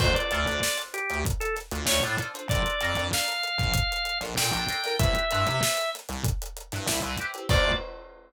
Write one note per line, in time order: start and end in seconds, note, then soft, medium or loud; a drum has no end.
0.00 0.13 D2 medium
0.00 0.26 D4 loud
0.00 0.26 F4 loud
0.00 0.26 A4 loud
0.00 0.15 C5 medium
0.00 0.26 C5 loud
0.00 kick loud
0.00 crash loud
0.15 0.78 D5 medium
0.15 closed hi-hat medium
0.31 0.45 D2 medium
0.31 0.44 D4 medium
0.31 0.44 F4 medium
0.31 0.44 A4 medium
0.31 0.44 C5 medium
0.31 closed hi-hat medium
0.46 0.60 D2 medium
0.46 0.97 D4 medium
0.46 0.97 F4 medium
0.46 0.97 A4 medium
0.46 0.97 C5 medium
0.46 closed hi-hat medium
0.63 snare loud
0.78 closed hi-hat medium
0.94 1.19 G4 medium
0.94 closed hi-hat medium
1.10 1.24 D2 medium
1.10 closed hi-hat medium
1.25 kick loud
1.25 closed hi-hat loud
1.40 1.55 A4 medium
1.40 closed hi-hat medium
1.56 snare soft
1.56 closed hi-hat medium
1.71 1.86 D2 medium
1.71 1.85 D4 medium
1.71 1.85 F4 medium
1.71 1.85 A4 medium
1.71 1.85 C5 medium
1.71 closed hi-hat medium
1.86 2.00 D2 medium
1.86 2.00 D4 loud
1.86 2.00 F4 medium
1.86 2.00 A4 medium
1.86 2.00 C5 medium
1.86 2.03 C#5 medium
1.86 snare loud
2.03 2.17 A2 medium
2.03 2.16 D4 medium
2.03 2.16 F4 medium
2.03 2.16 A4 medium
2.03 2.16 C5 medium
2.03 closed hi-hat medium
2.18 2.32 D4 medium
2.18 2.32 F4 loud
2.18 2.32 A4 medium
2.18 2.32 C5 medium
2.18 closed hi-hat medium
2.34 2.47 D4 medium
2.34 2.47 F4 medium
2.34 2.47 A4 medium
2.34 2.47 C5 medium
2.34 closed hi-hat medium
2.48 2.62 A#1 loud
2.48 2.75 D4 loud
2.48 2.75 F4 loud
2.48 2.75 A4 loud
2.48 2.75 A#4 loud
2.48 3.04 D5 medium
2.48 kick loud
2.48 closed hi-hat loud
2.66 closed hi-hat medium
2.81 2.95 F2 medium
2.81 2.93 D4 medium
2.81 2.93 F4 medium
2.81 2.93 A4 medium
2.81 2.93 A#4 medium
2.81 closed hi-hat medium
2.95 3.11 F2 medium
2.95 3.46 D4 medium
2.95 3.46 F4 medium
2.95 3.46 A4 medium
2.95 3.46 A#4 medium
2.95 closed hi-hat medium
3.13 4.19 F5 medium
3.13 snare loud
3.28 closed hi-hat medium
3.43 closed hi-hat medium
3.58 3.72 A#1 medium
3.58 kick medium
3.58 closed hi-hat medium
3.74 kick loud
3.74 closed hi-hat loud
3.92 closed hi-hat medium
4.05 closed hi-hat medium
4.21 4.35 A#1 medium
4.21 4.34 D4 medium
4.21 4.34 F4 medium
4.21 4.34 A4 medium
4.21 4.34 A#4 medium
4.21 snare soft
4.21 closed hi-hat medium
4.37 4.51 A#2 medium
4.37 4.50 D4 loud
4.37 4.50 F4 medium
4.37 4.50 A4 loud
4.37 4.50 A#4 medium
4.37 4.96 G5 medium
4.37 snare loud
4.52 4.66 A#1 medium
4.52 4.65 D4 loud
4.52 4.65 F4 medium
4.52 4.65 A4 loud
4.52 4.65 A#4 medium
4.52 closed hi-hat medium
4.69 4.81 D4 medium
4.69 4.81 F4 medium
4.69 4.81 A4 medium
4.69 4.81 A#4 medium
4.69 snare soft
4.69 closed hi-hat loud
4.84 4.97 D4 medium
4.84 4.97 F4 medium
4.84 4.97 A4 medium
4.84 4.97 A#4 medium
4.84 snare soft
4.84 closed hi-hat medium
4.99 5.13 C2 loud
4.99 5.25 C4 loud
4.99 5.25 E4 loud
4.99 5.25 G4 loud
4.99 5.25 B4 loud
4.99 5.90 E5 medium
4.99 kick loud
4.99 closed hi-hat loud
5.15 closed hi-hat medium
5.31 5.46 G2 medium
5.31 5.44 C4 medium
5.31 5.44 E4 loud
5.31 5.44 G4 medium
5.31 5.44 B4 medium
5.31 closed hi-hat medium
5.47 5.61 C3 medium
5.47 5.98 C4 medium
5.47 5.98 E4 medium
5.47 5.98 G4 medium
5.47 5.98 B4 medium
5.47 closed hi-hat medium
5.63 snare loud
5.77 closed hi-hat medium
5.95 snare soft
5.95 closed hi-hat medium
6.09 6.23 C2 medium
6.09 snare soft
6.09 closed hi-hat medium
6.24 kick loud
6.24 closed hi-hat loud
6.42 closed hi-hat medium
6.57 closed hi-hat medium
6.72 6.87 G2 medium
6.72 6.85 C4 medium
6.72 6.85 E4 medium
6.72 6.85 G4 medium
6.72 6.85 B4 medium
6.72 snare soft
6.72 closed hi-hat medium
6.86 7.01 C2 medium
6.86 7.00 C4 medium
6.86 7.00 E4 loud
6.86 7.00 G4 medium
6.86 7.00 B4 loud
6.86 snare loud
7.02 7.17 C2 medium
7.02 7.15 C4 medium
7.02 7.15 E4 medium
7.02 7.15 G4 medium
7.02 7.15 B4 medium
7.02 closed hi-hat medium
7.18 7.32 C4 medium
7.18 7.32 E4 medium
7.18 7.32 G4 medium
7.18 7.32 B4 medium
7.18 closed hi-hat medium
7.34 7.47 C4 medium
7.34 7.47 E4 medium
7.34 7.47 G4 medium
7.34 7.47 B4 medium
7.34 closed hi-hat medium
7.49 7.71 D2 loud
7.49 7.73 D4 medium
7.49 7.73 F4 loud
7.49 7.73 A4 loud
7.49 7.73 C5 loud
7.49 7.72 D5 loud
7.49 kick loud
7.49 crash loud